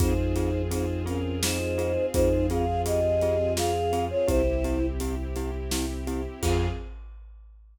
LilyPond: <<
  \new Staff \with { instrumentName = "Choir Aahs" } { \time 3/4 \key f \minor \tempo 4 = 84 <ees' c''>4 <ees' c''>8 <des' bes'>8 <ees' c''>4 | <ees' c''>8 <aes' f''>8 <g' ees''>4 <aes' f''>8. <f' des''>16 | <e' c''>4 r2 | f''4 r2 | }
  \new Staff \with { instrumentName = "Glockenspiel" } { \time 3/4 \key f \minor <c' f' aes'>8 <c' f' aes'>8 <c' f' aes'>8 <c' f' aes'>8 <c' f' aes'>8 <c' f' aes'>8 | <c' f' aes'>8 <c' f' aes'>8 <c' f' aes'>8 <c' f' aes'>8 <c' f' aes'>8 <c' f' aes'>8 | <c' e' g'>8 <c' e' g'>8 <c' e' g'>8 <c' e' g'>8 <c' e' g'>8 <c' e' g'>8 | <c' f' aes'>4 r2 | }
  \new Staff \with { instrumentName = "Synth Bass 2" } { \clef bass \time 3/4 \key f \minor f,2. | f,2. | c,2. | f,4 r2 | }
  \new Staff \with { instrumentName = "String Ensemble 1" } { \time 3/4 \key f \minor <c' f' aes'>2.~ | <c' f' aes'>2. | <c' e' g'>2. | <c' f' aes'>4 r2 | }
  \new DrumStaff \with { instrumentName = "Drums" } \drummode { \time 3/4 <hh bd>8 hh8 hh8 hh8 sn8 hh8 | <hh bd>8 hh8 hh8 hh8 sn8 hh8 | <hh bd>8 hh8 hh8 hh8 sn8 hh8 | <cymc bd>4 r4 r4 | }
>>